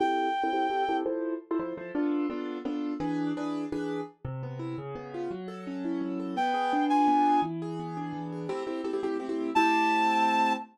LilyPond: <<
  \new Staff \with { instrumentName = "Clarinet" } { \time 6/8 \key a \minor \tempo 4. = 113 g''2. | r2. | r2. | r2. |
r2. | r2. | g''4. aes''4. | r2. |
r2. | a''2. | }
  \new Staff \with { instrumentName = "Acoustic Grand Piano" } { \time 6/8 \key a \minor <c' e' g' a'>4~ <c' e' g' a'>16 <c' e' g' a'>16 <c' e' g' a'>8 <c' e' g' a'>8 <c' e' g' a'>8 | <f e' a' c''>4~ <f e' a' c''>16 <f e' a' c''>16 <f e' a' c''>8 <f e' a' c''>8 <b d' f' a'>8~ | <b d' f' a'>8 <b d' f' a'>4 <b d' f' a'>4 <e d' gis' b'>8~ | <e d' gis' b'>8 <e d' gis' b'>4 <e d' gis' b'>4. |
c8 b8 e'8 cis8 b8 eis'8 | fis8 a'8 cis'8 e'8 fis8 a'8 | b8 aes'8 d'8 f'8 b8 aes'8 | e8 gis'8 b8 d'8 e8 gis'8 |
<a c' e' g'>8 <a c' e' g'>8 <a c' e' g'>16 <a c' e' g'>16 <a c' e' g'>8 <a c' e' g'>16 <a c' e' g'>8. | <a c' e' g'>2. | }
>>